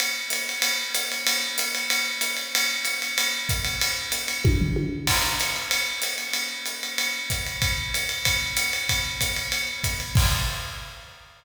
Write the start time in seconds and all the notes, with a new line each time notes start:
0.00 ride
0.30 hi-hat pedal, ride
0.49 ride
0.62 ride
0.95 hi-hat pedal, ride
1.12 ride
1.27 ride
1.58 hi-hat pedal, ride
1.75 ride
1.90 ride
2.21 hi-hat pedal, ride
2.37 ride
2.55 ride
2.85 hi-hat pedal, ride
3.02 ride
3.18 ride
3.49 kick, hi-hat pedal, ride
3.65 ride
3.81 ride
4.12 hi-hat pedal, ride
4.28 ride
4.45 kick, high tom
4.61 floor tom
4.76 high tom
5.07 kick, crash, ride
5.40 hi-hat pedal, ride
5.56 ride
5.71 ride
6.02 hi-hat pedal, ride
6.18 ride
6.33 ride
6.66 hi-hat pedal, ride
6.83 ride
6.98 ride
7.30 kick, hi-hat pedal, ride
7.46 ride
7.62 kick, ride
7.94 hi-hat pedal, ride
8.09 ride
8.25 kick, ride
8.57 hi-hat pedal, ride
8.73 ride
8.89 kick, ride
9.21 kick, hi-hat pedal, ride
9.36 ride
9.52 ride
9.84 kick, hi-hat pedal, ride
10.00 ride
10.15 kick, crash